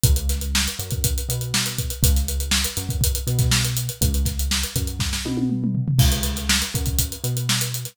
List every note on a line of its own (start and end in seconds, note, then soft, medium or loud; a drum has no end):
0.04 0.68 C#2 loud
0.04 kick loud
0.04 closed hi-hat loud
0.16 closed hi-hat medium
0.29 snare medium
0.29 closed hi-hat medium
0.41 closed hi-hat medium
0.55 snare loud
0.68 closed hi-hat medium
0.79 1.21 F#2 medium
0.79 closed hi-hat medium
0.91 kick loud
0.91 closed hi-hat medium
1.04 kick loud
1.04 closed hi-hat loud
1.18 closed hi-hat medium
1.29 1.92 B2 medium
1.29 closed hi-hat loud
1.41 closed hi-hat medium
1.54 snare loud
1.65 snare medium
1.65 closed hi-hat medium
1.79 kick medium
1.79 closed hi-hat medium
1.90 closed hi-hat medium
2.03 2.66 C#2 loud
2.03 kick loud
2.03 closed hi-hat loud
2.16 snare soft
2.16 closed hi-hat medium
2.28 closed hi-hat loud
2.40 closed hi-hat medium
2.51 snare loud
2.64 closed hi-hat loud
2.77 3.19 F#2 loud
2.77 snare soft
2.77 closed hi-hat medium
2.89 kick loud
2.89 closed hi-hat medium
3.01 kick loud
3.01 closed hi-hat loud
3.15 closed hi-hat medium
3.27 3.90 B2 loud
3.27 closed hi-hat medium
3.39 kick loud
3.39 snare soft
3.39 closed hi-hat medium
3.51 snare loud
3.65 closed hi-hat medium
3.77 closed hi-hat loud
3.89 closed hi-hat medium
4.01 4.65 C#2 loud
4.01 kick loud
4.01 closed hi-hat loud
4.14 closed hi-hat medium
4.25 kick medium
4.25 snare soft
4.25 closed hi-hat medium
4.39 closed hi-hat medium
4.51 snare loud
4.63 closed hi-hat medium
4.75 5.18 F#2 loud
4.75 kick medium
4.75 snare soft
4.75 closed hi-hat loud
4.87 closed hi-hat medium
4.99 kick medium
4.99 snare medium
5.13 snare medium
5.25 5.88 B2 loud
5.25 high tom medium
5.37 high tom loud
5.50 mid tom medium
5.64 mid tom loud
5.75 floor tom loud
5.88 floor tom loud
5.99 6.63 C#2 loud
5.99 kick loud
5.99 crash loud
6.12 closed hi-hat medium
6.23 snare soft
6.23 closed hi-hat loud
6.36 snare soft
6.36 closed hi-hat medium
6.49 snare loud
6.62 closed hi-hat medium
6.74 7.16 F#2 loud
6.74 kick loud
6.74 closed hi-hat medium
6.86 kick medium
6.86 closed hi-hat medium
6.99 kick medium
6.99 closed hi-hat loud
7.12 closed hi-hat medium
7.24 7.87 B2 medium
7.24 closed hi-hat medium
7.37 closed hi-hat medium
7.49 snare loud
7.61 closed hi-hat loud
7.74 closed hi-hat medium
7.85 snare soft
7.85 closed hi-hat medium